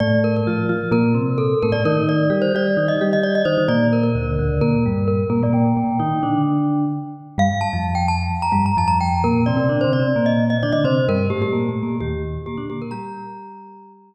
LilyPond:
<<
  \new Staff \with { instrumentName = "Glockenspiel" } { \time 4/4 \key bes \major \tempo 4 = 130 d''8 bes'16 bes'4~ bes'16 bes'4 a'8 bes'16 d''16 | bes'8 d''8. c''16 d''8. ees''8 ees''16 d''16 ees''16 c''8 | d''8 bes'16 bes'4~ bes'16 bes'4 bes'8 bes'16 d''16 | g''2 r2 |
f''8 a''8. g''16 a''8. bes''8 bes''16 a''16 bes''16 g''8 | bes'8 d''8. c''16 d''8. ees''8 ees''16 d''16 ees''16 c''8 | bes'8 g'16 g'4~ g'16 g'4 g'8 g'16 bes'16 | bes''2~ bes''8 r4. | }
  \new Staff \with { instrumentName = "Vibraphone" } { \time 4/4 \key bes \major <a, a>4 <f f'>8 <f f'>8 <bes, bes>8 <c c'>4 <a, a>16 <a, a>16 | <ees ees'>4 <g g'>8 <g g'>8 <ees ees'>8 <g g'>4 <ees ees'>16 <ees ees'>16 | <bes, bes>4 <d, d>8 <d, d>8 <bes, bes>8 <g, g>4 <bes, bes>16 <bes, bes>16 | <bes, bes>8 <bes, bes>8 <ees ees'>8 <d d'>4. r4 |
<g, g>16 r8 <f, f>4~ <f, f>16 r8 <g, g>8 <f, f>4 | <bes, bes>8 <c c'>16 <c c'>16 \tuplet 3/2 { <d d'>8 <c c'>8 <c c'>8 } <bes, bes>4 <d d'>16 <d d'>16 <c c'>8 | <g, g>8 <a, a>16 <a, a>16 \tuplet 3/2 { <bes, bes>8 <a, a>8 <bes, bes>8 } <ees, ees>4 <bes, bes>16 <d d'>16 <bes, bes>8 | <g g'>1 | }
>>